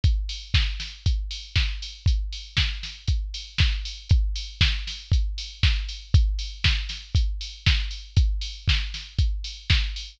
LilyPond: \new DrumStaff \drummode { \time 4/4 \tempo 4 = 118 <hh bd>8 hho8 <bd sn>8 <hho sn>8 <hh bd>8 hho8 <bd sn>8 hho8 | <hh bd>8 hho8 <bd sn>8 <hho sn>8 <hh bd>8 hho8 <bd sn>8 hho8 | <hh bd>8 hho8 <bd sn>8 <hho sn>8 <hh bd>8 hho8 <bd sn>8 hho8 | <hh bd>8 hho8 <bd sn>8 <hho sn>8 <hh bd>8 hho8 <bd sn>8 hho8 |
<hh bd>8 hho8 <bd sn>8 <hho sn>8 <hh bd>8 hho8 <bd sn>8 hho8 | }